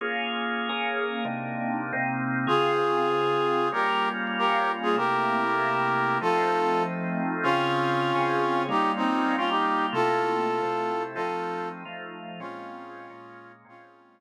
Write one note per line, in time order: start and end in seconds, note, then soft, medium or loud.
0.01 0.69 A#3 medium
0.01 0.69 C#4 medium
0.01 0.69 F4 medium
0.01 0.69 G#4 medium
0.69 1.24 A#3 medium
0.69 1.24 C#4 medium
0.69 1.24 G#4 medium
0.69 1.24 A#4 medium
1.25 1.92 C3 medium
1.25 1.92 A#3 medium
1.25 1.93 D4 medium
1.25 1.92 D#4 medium
1.93 2.48 C3 medium
1.93 2.48 A#3 medium
1.93 2.47 C4 medium
1.93 2.48 D#4 medium
2.47 3.70 C#3 medium
2.47 3.70 C4 medium
2.47 3.70 F4 medium
2.47 3.69 F4 medium
2.47 3.70 G#4 medium
2.47 3.69 G#4 medium
3.72 4.95 G3 medium
3.72 4.95 A#3 medium
3.72 4.95 C#4 medium
3.72 4.95 F4 medium
3.72 4.09 G4 medium
3.72 4.09 A#4 medium
4.39 4.72 G4 medium
4.39 4.72 A#4 medium
4.83 4.96 F4 medium
4.83 4.96 G#4 medium
4.96 6.19 C3 medium
4.96 6.19 A3 medium
4.96 6.19 A#3 medium
4.96 6.19 E4 medium
4.96 6.18 G4 medium
4.96 6.18 A#4 medium
6.21 7.44 F3 medium
6.21 7.44 A3 medium
6.21 7.44 C4 medium
6.21 7.44 D#4 medium
6.21 6.83 F4 medium
6.21 6.83 A4 medium
7.43 8.12 C#3 medium
7.43 8.12 C4 medium
7.43 8.63 C#4 medium
7.43 8.63 F4 medium
7.43 8.12 F4 medium
7.43 8.12 G#4 medium
8.15 8.70 C#3 medium
8.15 8.70 C4 medium
8.15 8.68 C#4 medium
8.15 8.70 G#4 medium
8.68 9.36 G3 medium
8.68 9.36 A#3 medium
8.68 9.36 C#4 medium
8.68 8.92 D#4 medium
8.68 9.36 F4 medium
8.68 8.92 G4 medium
8.96 9.35 C4 medium
8.96 9.35 D#4 medium
9.37 9.93 G3 medium
9.37 9.92 A#3 medium
9.37 9.50 C#4 medium
9.37 9.50 F4 medium
9.37 9.93 F4 medium
9.37 9.93 G4 medium
9.49 9.86 D#4 medium
9.49 9.86 G4 medium
9.93 10.61 C3 medium
9.93 10.61 A3 medium
9.93 10.61 A#3 medium
9.93 10.61 E4 medium
9.93 11.03 F4 medium
9.93 11.03 A4 medium
10.62 11.17 C3 medium
10.62 11.15 A3 medium
10.62 11.15 C4 medium
10.62 11.17 E4 medium
11.15 11.84 F3 medium
11.15 11.84 A3 medium
11.15 11.84 C4 medium
11.15 11.84 D#4 medium
11.15 11.69 F4 medium
11.15 11.69 A4 medium
11.85 12.40 F3 medium
11.85 12.40 A3 medium
11.85 12.40 D#4 medium
11.85 12.40 F4 medium
12.40 13.08 A#2 medium
12.40 13.08 G#3 medium
12.40 13.08 C4 medium
12.40 13.52 C#4 medium
12.40 13.08 C#4 medium
12.40 13.52 F4 medium
13.10 13.64 A#2 medium
13.10 13.64 G#3 medium
13.10 13.65 A#3 medium
13.10 13.64 C#4 medium
13.65 14.20 A#2 medium
13.65 14.20 G#3 medium
13.65 14.20 C4 medium
13.65 14.20 C#4 medium
13.65 14.20 F4 medium